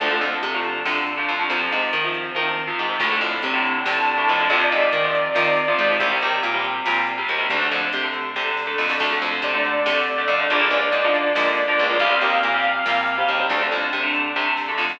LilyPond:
<<
  \new Staff \with { instrumentName = "Lead 2 (sawtooth)" } { \time 7/8 \key d \minor \tempo 4 = 140 r2. r8 | r2. r8 | r2 a''4. | d''2.~ d''8 |
r2. r8 | r2. r8 | r4 d''2~ d''8 | d''2.~ d''8 |
f''2.~ f''8 | r2. r8 | }
  \new Staff \with { instrumentName = "Overdriven Guitar" } { \time 7/8 \key d \minor <d f a>16 <d f a>4 <d f a>8. <d f a>8. <d f a>8 <d f a>16 | <c f>16 <c f>4 <c f>8. <c f>8. <c f>8 <c f>16 | <a, d>16 <a, d>4 <a, d>8. <a, d>8. <a, d>8 <a, d>16 | <c f>16 <c f>4 <c f>8. <c f>8. <c f>8 <c f>16 |
<c g>16 <c g>4 <c g>8. <c g>8. <c g>8 <c g>16 | <d a>16 <d a>4 <d a>8. <d a>8. <d a>8 <d a>16 | <d a>16 <d a>4 <d a>8. <d a>8. <d a>8 <d a>16 | <d f bes>16 <d f bes>4 <d f bes>8. <d f bes>8. <d f bes>8 <d f bes>16 |
<c g>16 <c g>4 <c g>8. <c g>8. <c g>8 <c g>16 | <d a>16 <d a>4 <d a>8. <d a>8. <d a>8 <d a>16 | }
  \new Staff \with { instrumentName = "Electric Bass (finger)" } { \clef bass \time 7/8 \key d \minor d,8 f,8 c4 c4 f,8 | f,8 aes,8 ees4 ees4 aes,8 | d,8 f,8 c4 c4 f,8 | f,8 aes,8 ees4 ees4 aes,8 |
c,8 ees,8 bes,4 bes,4 ees,8 | d,8 f,8 c4 c4 f,8 | d,8 f,8 c4 c4 f,8 | bes,,8 cis,8 aes,4 aes,4 cis,8 |
c,8 ees,8 bes,4 bes,4 ees,8 | d,8 f,8 c4 c4 f,8 | }
  \new DrumStaff \with { instrumentName = "Drums" } \drummode { \time 7/8 <hh bd>8 hh8 hh8 hh8 sn8 hh8 hh8 | <hh bd>8 hh8 hh8 hh8 <bd tommh>8 tomfh4 | <cymc bd>8 hh8 hh8 hh8 sn8 hh8 hh8 | <hh bd>8 hh8 hh8 hh8 sn8 hh8 hh8 |
<hh bd>8 hh8 hh8 hh8 sn8 hh8 hh8 | <hh bd>8 hh8 hh8 hh8 <bd sn>8 sn8 sn16 sn16 | <cymc bd>8 hh8 hh8 hh8 sn8 hh8 hh8 | <hh bd>8 hh8 hh8 hh8 sn8 hh8 hh8 |
<hh bd>8 hh8 hh8 hh8 sn8 hh8 hh8 | <hh bd>8 hh8 hh8 hh8 <bd sn>8 sn8 sn16 sn16 | }
>>